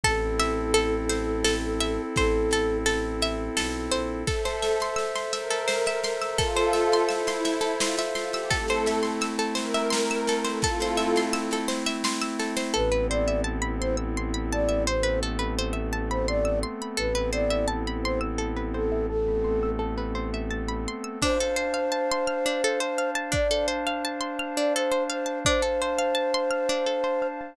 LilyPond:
<<
  \new Staff \with { instrumentName = "Flute" } { \time 3/4 \key a \phrygian \tempo 4 = 85 a'2. | a'4 r2 | r2. | r2. |
r2. | r2. | b'8 d''8 r8 c''16 r8. d''8 | c''8 r4 r16 c''16 d''8 r8 |
b'8 d''8 r8 c''16 r8. a'8 | a'4 r2 | \key d \phrygian c''2. | d''8 r4 r16 d''16 c''8 c''8 |
c''2. | }
  \new Staff \with { instrumentName = "Pad 5 (bowed)" } { \time 3/4 \key a \phrygian r2. | r2. | a'8. r8. bes'4~ bes'16 bes'16 | <f' a'>4 e'4 f'16 r16 f'16 g'16 |
a'8. r8. bes'4~ bes'16 a'16 | <f' a'>4 r2 | r2. | r2. |
r2. | r2. | \key d \phrygian r2. | r2. |
r2. | }
  \new Staff \with { instrumentName = "Pizzicato Strings" } { \time 3/4 \key a \phrygian a'8 e''8 a'8 c''8 a'8 e''8 | c''8 a'8 a'8 e''8 a'8 c''8 | a'16 c''16 e''16 c'''16 e'''16 c'''16 e''16 a'16 c''16 e''16 c'''16 e'''16 | a'16 c''16 e''16 c'''16 e'''16 c'''16 e''16 a'16 c''16 e''16 c'''16 e'''16 |
a'16 c''16 e''16 c'''16 e'''16 a'16 c''16 e''16 c'''16 e'''16 a'16 c''16 | a'16 c''16 e''16 c'''16 e'''16 a'16 c''16 e''16 c'''16 e'''16 a'16 c''16 | a'16 b'16 c''16 e''16 a''16 b''16 c'''16 e'''16 c'''16 b''16 a''16 e''16 | c''16 b'16 a'16 b'16 c''16 e''16 a''16 b''16 c'''16 e'''16 c'''16 b''16 |
a'16 b'16 c''16 e''16 a''16 b''16 c'''16 e'''16 a'16 b'16 c''16 e''16 | a''16 b''16 c'''16 e'''16 a'16 b'16 c''16 e''16 a''16 b''16 c'''16 e'''16 | \key d \phrygian d'16 a'16 c''16 f''16 a''16 c'''16 f'''16 d'16 a'16 c''16 f''16 a''16 | d'16 a'16 c''16 f''16 a''16 c'''16 f'''16 d'16 a'16 c''16 f''16 a''16 |
d'16 a'16 c''16 f''16 a''16 c'''16 f'''16 d'16 a'16 c''16 f''16 a''16 | }
  \new Staff \with { instrumentName = "Pad 5 (bowed)" } { \time 3/4 \key a \phrygian <c' e' a'>2.~ | <c' e' a'>2. | <a' c'' e''>2. | <a' c'' e''>2. |
<a c' e'>2. | <a c' e'>2. | <b c' e' a'>2. | <a b c' a'>2. |
<b c' e' a'>2. | <a b c' a'>2. | \key d \phrygian <d' c'' f'' a''>2. | <d' c'' f'' a''>2. |
<d' c'' f'' a''>2. | }
  \new Staff \with { instrumentName = "Violin" } { \clef bass \time 3/4 \key a \phrygian a,,2. | a,,2 b,,8 bes,,8 | r2. | r2. |
r2. | r2. | a,,2.~ | a,,2. |
a,,2.~ | a,,2. | \key d \phrygian r2. | r2. |
r2. | }
  \new DrumStaff \with { instrumentName = "Drums" } \drummode { \time 3/4 <bd sn>8 sn8 sn8 sn8 sn8 sn8 | <bd sn>8 sn8 sn8 sn8 sn8 sn8 | <bd sn>16 sn16 sn16 sn16 sn16 sn16 sn16 sn16 sn16 sn16 sn16 sn16 | <bd sn>16 sn16 sn16 sn16 sn16 sn16 sn16 sn16 sn16 sn16 sn16 sn16 |
<bd sn>16 sn16 sn16 sn16 sn16 sn16 sn16 sn16 sn16 sn16 sn16 sn16 | <bd sn>16 sn16 sn16 sn16 sn16 sn16 sn16 sn16 sn16 sn16 sn16 sn16 | r4 r4 r4 | r4 r4 r4 |
r4 r4 r4 | r4 r4 r4 | <cymc bd>4 r4 r4 | bd4 r4 r4 |
bd4 r4 r4 | }
>>